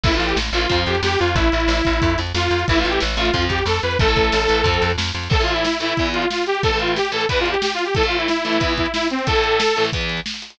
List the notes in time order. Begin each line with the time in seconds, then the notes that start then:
0.04 A1 E3 A3 E4, kick, crash
0.12 E3 A3 F4, closed hi-hat
0.19 A1, closed hi-hat
0.26 G4, closed hi-hat
0.36 A1, snare
0.45 closed hi-hat
0.52 A1 E3 A3 F4, closed hi-hat
0.62 closed hi-hat
0.69 F2 F3 C4, kick, closed hi-hat
0.78 closed hi-hat
0.86 F2 G4, snare, closed hi-hat
0.95 closed hi-hat
1.03 F2 G4, snare
1.11 closed hi-hat
1.19 F2 F4, closed hi-hat
1.28 closed hi-hat
1.35 A1 E4, kick, closed hi-hat
1.44 closed hi-hat
1.52 A1, closed hi-hat
1.60 closed hi-hat
1.68 A1, snare
1.77 closed hi-hat
1.85 A1, kick, closed hi-hat
1.93 closed hi-hat
2.02 F2, kick, closed hi-hat
2.10 closed hi-hat
2.18 F2, snare, closed hi-hat
2.27 closed hi-hat
2.34 F2 F4, snare
2.43 closed hi-hat
2.51 F2, closed hi-hat
2.59 closed hi-hat
2.68 A1 E3 A3 E4, kick, closed hi-hat
2.76 E3 A3 F4, closed hi-hat
2.84 A1, closed hi-hat
2.89 G4, closed hi-hat
3.00 A1, snare
3.09 closed hi-hat
3.17 A1 E3 A3 F4, closed hi-hat
3.25 closed hi-hat
3.34 F2 F3 C4, kick, closed hi-hat
3.42 closed hi-hat
3.49 F2 G4, kick, snare, closed hi-hat
3.58 closed hi-hat
3.66 F2 A4, snare
3.75 closed hi-hat
3.82 F2 B4, closed hi-hat
3.91 closed hi-hat
3.99 A1 E3 A3 A4, kick, closed hi-hat
4.08 E3 A3, closed hi-hat
4.16 A1, kick, closed hi-hat
4.24 closed hi-hat
4.32 A1, snare
4.41 closed hi-hat
4.48 A1 E3 A3, closed hi-hat
4.64 F2 F3 C4, kick, closed hi-hat
4.74 closed hi-hat
4.82 F2, snare, closed hi-hat
4.90 closed hi-hat
4.98 F2, snare
5.06 closed hi-hat
5.14 F2, closed hi-hat
5.23 closed hi-hat
5.30 A2 E3 A3 A4, kick, crash
5.39 A2 E3 A3 F4, closed hi-hat
5.48 closed hi-hat
5.53 E4, closed hi-hat
5.64 E4, snare
5.73 closed hi-hat
5.80 A2 E3 A3 E4, closed hi-hat
5.89 closed hi-hat
5.97 E2 E3 B3, kick, closed hi-hat
6.06 closed hi-hat
6.13 F4, closed hi-hat
6.22 closed hi-hat
6.30 F4, snare
6.38 closed hi-hat
6.46 G4, closed hi-hat
6.55 closed hi-hat
6.63 A2 E3 A3 A4, kick, closed hi-hat
6.71 A2 E3 A3, closed hi-hat
6.79 F4, closed hi-hat
6.88 closed hi-hat
6.96 G4, snare
7.05 closed hi-hat
7.12 A2 E3 A3 A4, closed hi-hat
7.21 closed hi-hat
7.29 E2 E3 B3 B4, kick, closed hi-hat
7.37 F4, closed hi-hat
7.46 closed hi-hat
7.51 G4, closed hi-hat
7.62 G4, snare
7.70 F4, closed hi-hat
7.79 closed hi-hat
7.85 G4, closed hi-hat
7.95 A2 E3 A3 A4, kick, closed hi-hat
8.03 A2 E3 A3 F4, closed hi-hat
8.12 closed hi-hat
8.18 E4, closed hi-hat
8.28 E4, snare
8.36 closed hi-hat
8.45 A2 E3 A3 E4, closed hi-hat
8.53 closed hi-hat
8.60 E2 E3 B3, kick, closed hi-hat
8.69 closed hi-hat
8.77 E4, kick, closed hi-hat
8.86 closed hi-hat
8.94 E4, snare
9.03 closed hi-hat
9.10 C4, closed hi-hat
9.19 closed hi-hat
9.27 A2 E3 A3 A4, kick, closed hi-hat
9.35 A2 E3 A3, closed hi-hat
9.44 closed hi-hat
9.52 closed hi-hat
9.60 snare
9.68 closed hi-hat
9.76 A2 E3 A3, closed hi-hat
9.85 closed hi-hat
9.93 E2 E3 B3, kick, closed hi-hat
10.01 closed hi-hat
10.09 closed hi-hat
10.17 closed hi-hat
10.26 snare
10.34 closed hi-hat
10.42 closed hi-hat
10.50 closed hi-hat